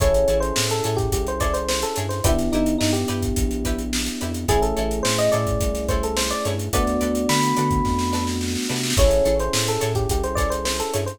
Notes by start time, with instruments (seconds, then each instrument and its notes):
0.00 synth bass 1 A1, electric piano 1 C#4 E4 G#4 A4 C#5, pizzicato strings E4 G#4 A4 C#5, kick, closed hi-hat
0.14 closed hi-hat
0.28 synth bass 1 A1, pizzicato strings E4 G#4 A4 C#5, closed hi-hat
0.40 electric piano 1 C5, closed hi-hat
0.56 synth bass 1 A2, snare
0.70 electric piano 1 A4, closed hi-hat
0.84 synth bass 1 A2, pizzicato strings E4 G#4 A4 C#5, closed hi-hat
0.97 electric piano 1 G4, kick, closed hi-hat
1.12 synth bass 1 C2, electric piano 1 G4, kick, closed hi-hat
1.27 electric piano 1 C5, closed hi-hat
1.40 pizzicato strings E4 G#4 A4 C#5, electric piano 1 D5, kick, snare, closed hi-hat
1.54 electric piano 1 C5, closed hi-hat
1.69 electric piano 1 C5, snare
1.82 electric piano 1 A4, closed hi-hat
1.96 synth bass 1 G2, pizzicato strings E4 G#4 A4 C#5, closed hi-hat
2.09 electric piano 1 C5, snare, closed hi-hat
2.24 synth bass 1 G1, electric piano 1 B3 D4 E4 G4, pizzicato strings E4 G4 B4 D5, kick, closed hi-hat
2.38 snare, closed hi-hat
2.52 synth bass 1 G1, electric piano 1 D#4, pizzicato strings E4 G4 B4 D5, closed hi-hat
2.66 closed hi-hat
2.79 synth bass 1 G2, electric piano 1 D#4, snare
2.93 electric piano 1 G4, closed hi-hat
3.08 synth bass 1 G2, pizzicato strings E4 G4 B4 D5, closed hi-hat
3.22 kick, closed hi-hat
3.36 synth bass 1 A#1, kick, closed hi-hat
3.51 closed hi-hat
3.65 pizzicato strings E4 G4 B4 D5, kick, closed hi-hat
3.79 closed hi-hat
3.93 snare
4.06 closed hi-hat
4.21 synth bass 1 F2, pizzicato strings E4 G4 B4 D5, closed hi-hat
4.34 closed hi-hat
4.48 synth bass 1 A1, electric piano 1 A3 C#4 E4 G#4, pizzicato strings E4 G#4 A4 C#5, kick, closed hi-hat
4.62 electric piano 1 A4, closed hi-hat
4.77 synth bass 1 A1, pizzicato strings E4 G#4 A4 C#5, closed hi-hat
4.91 closed hi-hat
5.03 synth bass 1 A2, electric piano 1 C5, snare
5.18 electric piano 1 D#5, closed hi-hat
5.32 synth bass 1 A2, pizzicato strings E4 G#4 A4 C#5, electric piano 1 D5, closed hi-hat
5.47 kick, closed hi-hat
5.60 synth bass 1 C2, kick, closed hi-hat
5.75 snare, closed hi-hat
5.88 pizzicato strings E4 G#4 A4 C#5, electric piano 1 C5, kick, closed hi-hat
6.03 electric piano 1 A4, closed hi-hat
6.17 electric piano 1 C5, snare
6.30 electric piano 1 D5, snare, closed hi-hat
6.45 synth bass 1 G2, pizzicato strings E4 G#4 A4 C#5, closed hi-hat
6.59 closed hi-hat
6.73 synth bass 1 D2, electric piano 1 A3 B3 D4 F#4 D5, pizzicato strings F#4 A4 B4 D5, kick, closed hi-hat
6.87 snare, closed hi-hat
7.01 synth bass 1 D2, pizzicato strings F#4 A4 B4 D5, closed hi-hat
7.15 closed hi-hat
7.29 synth bass 1 D3, electric piano 1 B5, snare
7.43 closed hi-hat
7.57 synth bass 1 D3, pizzicato strings F#4 A4 B4 D5, closed hi-hat
7.71 kick, closed hi-hat
7.85 synth bass 1 F2, kick, snare
7.99 snare
8.13 pizzicato strings F#4 A4 B4 D5, snare
8.27 snare
8.41 snare
8.48 snare
8.55 snare
8.62 snare
8.69 synth bass 1 C3, pizzicato strings F#4 A4 B4 D5, snare
8.76 snare
8.83 snare
8.90 snare
8.97 synth bass 1 A1, electric piano 1 C#4 E4 G#4 A4 C#5, pizzicato strings E4 G#4 A4 C#5, kick, closed hi-hat
9.11 closed hi-hat
9.25 synth bass 1 A1, pizzicato strings E4 G#4 A4 C#5, closed hi-hat
9.39 electric piano 1 C5, closed hi-hat
9.53 synth bass 1 A2, snare
9.68 electric piano 1 A4, closed hi-hat
9.81 synth bass 1 A2, pizzicato strings E4 G#4 A4 C#5, closed hi-hat
9.95 electric piano 1 G4, kick, closed hi-hat
10.09 synth bass 1 C2, electric piano 1 G4, kick, closed hi-hat
10.23 electric piano 1 C5, closed hi-hat
10.35 pizzicato strings E4 G#4 A4 C#5, electric piano 1 D5, kick, snare, closed hi-hat
10.50 electric piano 1 C5, closed hi-hat
10.65 electric piano 1 C5, snare
10.80 electric piano 1 A4, closed hi-hat
10.94 synth bass 1 G2, pizzicato strings E4 G#4 A4 C#5, closed hi-hat
11.06 electric piano 1 C5, snare, closed hi-hat